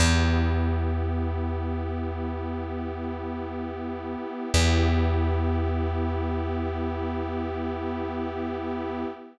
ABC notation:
X:1
M:4/4
L:1/8
Q:1/4=53
K:Edor
V:1 name="Pad 5 (bowed)"
[B,EG]8 | [B,EG]8 |]
V:2 name="Electric Bass (finger)" clef=bass
E,,8 | E,,8 |]